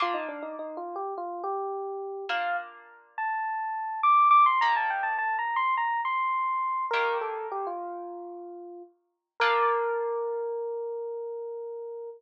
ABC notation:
X:1
M:4/4
L:1/16
Q:1/4=104
K:Bb
V:1 name="Electric Piano 1"
F E D E (3E2 F2 G2 F2 G6 | f2 z4 a6 d'2 d' c' | b a g a (3a2 b2 c'2 b2 c'6 | "^rit." B2 A2 G F9 z2 |
B16 |]
V:2 name="Orchestral Harp"
[B,DF]16 | [B,DF]16 | [E,B,G]16 | "^rit." [E,B,G]16 |
[B,DF]16 |]